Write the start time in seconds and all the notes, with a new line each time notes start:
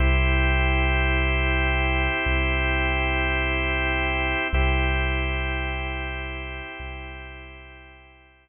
0.00 C2 C4 E4 G4
2.26 C2
4.53 C2 C4 E4 G4
6.79 C2